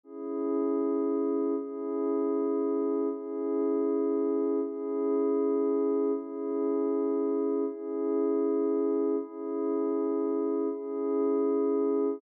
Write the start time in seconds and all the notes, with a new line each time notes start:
0.03 C#4 E4 G#4
1.57 C#4 E4 G#4
3.09 C#4 E4 G#4
4.61 C#4 E4 G#4
6.13 C#4 E4 G#4
7.65 C#4 E4 G#4
9.17 C#4 E4 G#4
10.69 C#4 E4 G#4